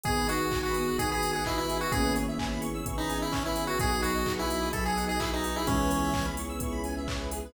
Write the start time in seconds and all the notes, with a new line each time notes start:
0.04 G#1 B3 D#4 F#4 G#4, kick, closed hi-hat
0.17 B4
0.27 D#4 F#4 D#5, open hi-hat
0.39 F#5
0.51 B3 D#4 F#4 G#4 G#5, kick, clap
0.63 F#4 B5
0.74 B3 D#6, open hi-hat
0.88 F#6
0.97 G#1 B3 D#4 F#4 G#4 D#6, kick, closed hi-hat
1.09 G#4 B5
1.23 G#5, open hi-hat
1.33 G#4 F#5
1.45 B3 D#4 E4 F#4 G#4 D#5, kick, clap
1.57 E4 B4
1.68 G#4, open hi-hat
1.81 F#4 B4
1.91 G#1 A#3 B3 C#4 E4 G#4, kick, closed hi-hat
2.03 B4
2.16 C#5, open hi-hat
2.28 E5
2.38 B3 C#4 E4 G#4 G#5, kick, clap
2.51 B5
2.61 C#6, open hi-hat
2.74 E6
2.86 G#1 B3 C#4 E4 G#4 C#6, kick, closed hi-hat
2.98 D#4 B5
3.09 G#5, open hi-hat
3.22 E4 E5
3.32 B3 C#4 E4 G#4 C#5, kick, clap
3.45 E4 B4
3.56 G#4, open hi-hat
3.67 F#4 B4
3.79 B1 B3 D#4 F#4 G#4, kick, closed hi-hat
3.92 G#4
4.01 F#3 F#4 B4, open hi-hat
4.14 D#5
4.26 B3 D#4 F#4 G#4 F#5, kick, clap
4.38 E4 G#5
4.49 B3 B5, open hi-hat
4.61 D#6
4.72 B1 F#3 B3 D#4 F#4 G#4 A4 B5, kick, closed hi-hat
4.84 G#4 G#5
4.96 F#5, open hi-hat
5.07 G#4 D#5
5.20 B3 D#4 E4 F#4 G#4 B4, kick, clap
5.33 D#4 G#4
5.44 F#4, open hi-hat
5.56 E4 G#4
5.67 C#2 E3 G#3 B3 C#4 E4 G#4, kick, closed hi-hat
5.79 B4
5.90 C#5, open hi-hat
6.03 E5
6.13 B3 C#4 E4 G#4 G#5, kick, clap
6.25 B5
6.37 B3 C#6, open hi-hat
6.49 E6
6.60 C#2 B3 C#4 E4 G#4 C#6, kick, closed hi-hat
6.72 B5
6.84 G#5, open hi-hat
6.97 E5
7.07 B3 C#4 E4 G#4 C#5, kick, clap
7.19 B4
7.31 G#4, open hi-hat
7.45 B4